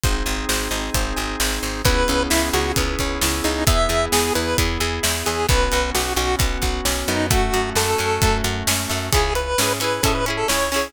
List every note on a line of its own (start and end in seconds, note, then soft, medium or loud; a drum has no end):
0.03 0.23 G#1 medium
0.03 1.82 C4 medium
0.03 1.82 D#4 medium
0.03 1.82 G#4 medium
0.03 0.48 C5 medium
0.03 kick loud
0.03 closed hi-hat medium
0.26 0.45 G#1 medium
0.26 1.16 G#5 soft
0.49 0.68 G#1 medium
0.49 0.94 C5 medium
0.49 snare loud
0.71 0.90 G#1 medium
0.71 1.39 D#5 medium
0.94 1.14 G#1 medium
0.94 1.62 C5 medium
0.94 kick medium
0.94 closed hi-hat loud
1.16 1.36 G#1 medium
1.16 1.81 G#5 medium
1.40 1.59 G#1 medium
1.40 1.83 D#5 medium
1.40 snare loud
1.63 1.82 G#1 medium
1.63 1.84 C5 medium
1.84 2.04 C#2 medium
1.84 2.77 B3 medium
1.84 3.64 B3 medium
1.84 3.64 C#4 medium
1.84 3.64 E4 medium
1.84 3.64 G#4 medium
1.84 2.23 B4 medium
1.84 kick loud
1.84 closed hi-hat loud
2.08 2.28 C#2 medium
2.08 2.99 C#4 medium
2.08 closed hi-hat medium
2.30 2.50 C#2 medium
2.30 3.22 E4 medium
2.30 2.49 E4 medium
2.30 snare loud
2.53 2.73 C#2 medium
2.53 2.72 F#4 medium
2.53 3.44 G#4 medium
2.53 closed hi-hat medium
2.76 2.96 C#2 medium
2.76 3.64 B3 medium
2.76 kick medium
2.76 closed hi-hat loud
2.99 3.19 C#2 medium
2.99 3.65 C#4 medium
2.99 kick medium
2.99 closed hi-hat medium
3.21 3.41 C#2 medium
3.21 3.66 E4 medium
3.21 snare loud
3.44 3.64 C#2 medium
3.44 3.64 D#4 medium
3.44 3.66 G#4 medium
3.44 closed hi-hat medium
3.67 3.87 E2 medium
3.67 4.12 B3 medium
3.67 5.45 B3 medium
3.67 5.45 E4 medium
3.67 5.45 G#4 medium
3.67 4.06 E5 medium
3.67 kick loud
3.67 closed hi-hat loud
3.89 4.08 E2 medium
3.89 4.80 G#4 medium
3.89 closed hi-hat medium
4.12 4.31 E2 medium
4.12 4.58 B3 medium
4.12 4.33 G#4 medium
4.12 snare loud
4.35 4.55 E2 medium
4.35 5.03 E4 medium
4.35 4.57 B4 medium
4.35 closed hi-hat medium
4.58 4.78 E2 medium
4.58 5.25 B3 medium
4.58 kick medium
4.58 closed hi-hat loud
4.80 5.00 E2 medium
4.80 5.46 G#4 medium
4.80 closed hi-hat medium
5.03 5.23 E2 medium
5.03 5.46 E4 medium
5.03 snare loud
5.26 5.46 E2 medium
5.26 5.47 B3 medium
5.26 5.47 G#4 medium
5.26 closed hi-hat medium
5.48 5.69 B1 medium
5.48 5.94 B3 medium
5.48 7.27 B3 medium
5.48 7.27 C#4 medium
5.48 7.27 F#4 medium
5.48 5.90 B4 medium
5.48 kick loud
5.48 closed hi-hat medium
5.72 5.92 B1 medium
5.72 6.62 F#4 medium
5.72 closed hi-hat medium
5.95 6.14 B1 medium
5.95 6.40 B3 medium
5.95 6.13 F#4 medium
5.95 snare loud
6.16 6.36 B1 medium
6.16 6.85 C#4 medium
6.16 6.36 F#4 medium
6.16 closed hi-hat medium
6.39 6.58 B1 medium
6.39 7.08 B3 medium
6.39 kick loud
6.39 closed hi-hat loud
6.62 6.81 B1 medium
6.62 7.27 F#4 medium
6.62 kick medium
6.62 closed hi-hat medium
6.85 7.04 B1 medium
6.85 7.28 C#4 medium
6.85 snare loud
7.08 7.50 F#2 medium
7.08 7.31 B3 medium
7.08 7.27 D#4 medium
7.08 closed hi-hat medium
7.30 7.76 A3 medium
7.30 9.09 A3 medium
7.30 9.09 C#4 medium
7.30 7.70 F#4 medium
7.30 9.09 F#4 medium
7.30 kick loud
7.30 closed hi-hat loud
7.53 7.73 F#2 medium
7.53 8.44 F#4 medium
7.53 closed hi-hat medium
7.75 7.95 F#2 medium
7.75 8.22 A3 medium
7.75 8.38 A4 medium
7.75 snare loud
7.98 8.19 F#2 medium
7.98 8.68 C#4 medium
7.98 closed hi-hat medium
8.22 8.42 F#2 medium
8.22 8.89 A3 medium
8.22 kick loud
8.22 closed hi-hat loud
8.44 8.63 F#2 medium
8.44 9.09 F#4 medium
8.44 closed hi-hat medium
8.67 8.86 F#2 medium
8.67 9.11 C#4 medium
8.67 snare loud
8.89 9.10 F#2 medium
8.89 9.11 A3 medium
8.89 snare medium
9.12 9.55 C#2 medium
9.12 9.54 C#4 medium
9.12 9.54 E4 medium
9.12 9.34 G#4 medium
9.12 kick medium
9.12 closed hi-hat loud
9.16 9.54 G#4 medium
9.35 9.73 B4 medium
9.35 closed hi-hat medium
9.58 10.00 G#2 medium
9.58 9.79 C#4 medium
9.58 9.80 E4 medium
9.58 snare loud
9.62 9.80 G#4 medium
9.80 10.01 C#4 medium
9.80 10.01 E4 medium
9.80 10.01 G#4 medium
9.80 10.03 B4 medium
9.80 closed hi-hat medium
10.03 10.44 G#2 medium
10.03 10.24 C#4 medium
10.03 10.24 E4 medium
10.03 10.14 A4 medium
10.03 kick medium
10.03 closed hi-hat loud
10.07 10.24 G#4 medium
10.15 10.25 B4 medium
10.26 10.47 C#4 medium
10.26 10.47 E4 medium
10.26 10.47 G#4 medium
10.26 closed hi-hat medium
10.37 10.48 A4 medium
10.48 10.90 C#2 medium
10.48 10.69 C#4 medium
10.48 10.69 E4 medium
10.48 10.69 G#4 medium
10.48 10.88 C#5 medium
10.48 snare loud
10.72 10.93 C#4 medium
10.72 10.93 E4 medium
10.72 open hi-hat medium
10.76 10.93 G#4 medium